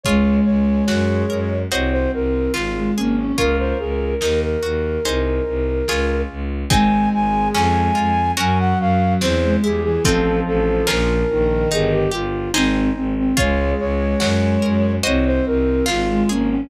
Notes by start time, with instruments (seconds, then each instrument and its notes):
0.03 violin C#2 G#3, acoustic guitar (steel) F4 G#4 C#5, flute C#5, kick, closed hi-hat
0.45 violin C#2, flute C#5
0.88 violin F#2, acoustic guitar (steel) F#4, flute C#5, snare
1.29 violin F#2, acoustic guitar (steel) A#4
1.70 violin C2 C4, acoustic guitar (steel) F#4 C5 D#5, flute C#5, closed hi-hat
1.91 flute C5
2.13 violin C2, flute A#4
2.53 violin G#1, flute F4, acoustic guitar (steel) F4, snare
2.74 violin G#3
2.96 violin G#1 A#3, flute C#4, acoustic guitar (steel) G#4
3.16 flute C#4, violin C#4
3.37 violin C#2 A#4, acoustic guitar (steel) F4 A#4 C#5, flute A#4, kick, closed hi-hat
3.59 flute C5
3.79 violin C#2, flute G#4
4.21 violin D#2, acoustic guitar (steel) D#4, flute A#4, snare
4.43 flute A#4
4.63 violin D#2, acoustic guitar (steel) F#4
5.05 violin C2, acoustic guitar (steel) D#4 G#4 C5, closed hi-hat
5.47 violin C2
5.88 violin C#2, acoustic guitar (steel) F4 G#4 C#5, snare
6.29 violin C#2
6.70 violin G#1 G#3, acoustic guitar (steel) C4 D#4 G#4, flute G#5, kick, closed hi-hat
7.13 violin G#1, flute G#5
7.54 violin F2, acoustic guitar (steel) C#4, flute G#5, snare
7.95 violin F2, acoustic guitar (steel) F4
8.37 violin F#2 F#3, acoustic guitar (steel) C#4 F#4 A#4, flute G#5, closed hi-hat
8.59 flute F#5
8.79 violin F#2, flute F5
9.21 violin E2, acoustic guitar (steel) C4, flute C5, snare
9.43 violin G#3
9.62 violin E2 G3, acoustic guitar (steel) E4, flute G#4
9.84 violin E3, flute G#4
10.04 violin A1 F3, acoustic guitar (steel) C4 D#4 F4 A4, flute A4, kick, closed hi-hat
10.46 violin A1, flute A4
10.87 violin A#1, acoustic guitar (steel) C#4 F4 A#4, flute A#4, snare
11.30 violin A#1 D#3
11.71 violin G1, acoustic guitar (steel) D#4, flute G#4, closed hi-hat
11.91 flute G4
12.11 violin G1, flute F4, acoustic guitar (steel) G4
12.54 violin G#1, flute C4, acoustic guitar (steel) D#4 G#4 C5, snare
12.95 violin G#1, flute C4
13.17 flute C4
13.37 violin C#2 G#3, acoustic guitar (steel) F4 G#4 C#5, flute C#5, kick, closed hi-hat
13.80 violin C#2, flute C#5
14.20 violin F#2, acoustic guitar (steel) F#4, flute C#5, snare
14.62 violin F#2, acoustic guitar (steel) A#4
15.03 violin C2 C4, acoustic guitar (steel) F#4 C5 D#5, flute C#5, closed hi-hat
15.26 flute C5
15.46 violin C2, flute A#4
15.86 violin G#1, acoustic guitar (steel) F4, flute F4, snare
16.09 violin G#3
16.29 violin G#1 A#3, flute C#4, acoustic guitar (steel) G#4
16.50 flute C#4, violin C#4